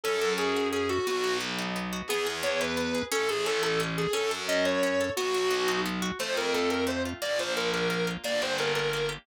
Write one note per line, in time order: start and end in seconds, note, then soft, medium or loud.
0.03 0.98 F#2 loud
0.03 0.37 C#4 medium
0.03 0.32 A4 loud
0.21 0.89 A4 medium
0.38 0.72 C#4 medium
0.38 0.67 G#4 medium
0.56 1.05 F#4 medium
0.72 1.05 C#4 medium
0.72 0.88 G#4 medium
0.89 1.05 F#4 loud
0.89 1.05 A4 medium
1.07 2.02 B1 loud
1.07 1.40 B3 medium
1.07 1.35 F#4 loud
1.24 1.92 F#4 medium
1.40 1.75 B3 medium
1.58 2.07 D#4 medium
1.76 2.08 B3 medium
1.93 2.09 F#4 medium
2.08 3.02 E2 loud
2.08 2.27 B3 loud
2.08 2.26 G#4 loud
2.27 2.44 G#4 medium
2.43 2.60 B3 medium
2.43 2.59 C#5 loud
2.60 2.78 E4 medium
2.60 3.02 B4 loud
2.77 2.94 B3 medium
2.95 3.11 G#4 medium
3.12 4.07 A1 loud
3.12 3.29 C#4 loud
3.12 3.27 A4 loud
3.29 3.44 G#4 medium
3.29 3.46 A4 medium
3.46 3.63 C#4 medium
3.46 3.62 A4 loud
3.62 3.80 E4 medium
3.62 3.79 A4 medium
3.80 3.97 C#4 medium
3.97 4.12 G#4 loud
3.97 4.14 A4 medium
4.13 5.09 F#2 loud
4.13 4.30 C#4 loud
4.13 4.28 A4 loud
4.31 4.48 A4 medium
4.48 4.66 C#4 medium
4.48 4.63 D#5 medium
4.65 4.82 F#4 medium
4.65 5.09 C#5 loud
4.83 5.00 C#4 medium
5.01 5.17 A4 medium
5.16 6.11 B1 loud
5.16 5.34 B3 loud
5.16 5.79 F#4 loud
5.34 5.51 F#4 medium
5.51 5.68 B3 medium
5.68 5.85 D#4 medium
5.86 6.03 B3 medium
6.02 6.18 F#4 medium
6.19 7.14 F2 loud
6.19 6.54 A3 medium
6.19 6.35 C5 loud
6.37 7.05 F4 medium
6.37 6.53 A#4 loud
6.54 6.86 A3 medium
6.54 6.69 A4 medium
6.70 7.19 C4 medium
6.70 6.84 A#4 medium
6.87 7.19 A3 medium
6.87 7.02 C5 medium
7.05 7.22 F4 medium
7.22 8.17 A#1 loud
7.22 7.56 A#3 medium
7.22 7.38 D5 loud
7.39 8.07 F4 medium
7.39 7.53 C5 medium
7.56 7.89 A#3 medium
7.56 7.70 A#4 medium
7.73 8.22 D4 medium
7.73 7.88 A#4 medium
7.90 8.22 A#3 medium
7.90 8.06 A#4 medium
8.07 8.23 F4 medium
8.24 9.18 G1 medium
8.24 8.58 A#3 medium
8.24 8.41 D5 loud
8.42 9.08 G4 medium
8.42 8.58 C5 medium
8.58 8.93 A#3 medium
8.58 8.73 A#4 medium
8.75 9.24 D4 medium
8.75 8.91 A#4 medium
8.93 9.26 A#3 medium
8.93 9.08 A#4 medium
9.09 9.25 G4 medium